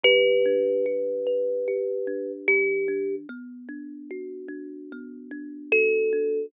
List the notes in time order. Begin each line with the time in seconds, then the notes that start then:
0.04 E3 G4 B4
0.46 D4
0.86 G4
1.27 B4
1.68 G4
2.07 D4
2.48 E3 G4
2.88 D4
3.29 B3
3.69 D4
4.11 F#4
4.48 D4
4.92 B3
5.31 D4
5.72 F#4 A4
6.13 D4